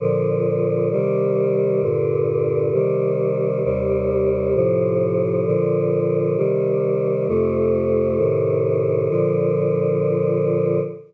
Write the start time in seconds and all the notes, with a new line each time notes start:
0.00 A#2 D3 F3
0.91 C3 D#3 G3
1.82 G2 A#2 D3
2.73 C3 D#3 G3
3.64 D#2 C3 G3
4.54 A2 C3 F3
5.46 A#2 D3 F3
6.37 C3 D#3 G3
7.27 F2 C3 A3
8.18 A2 C3 D#3
9.09 A#2 D3 F3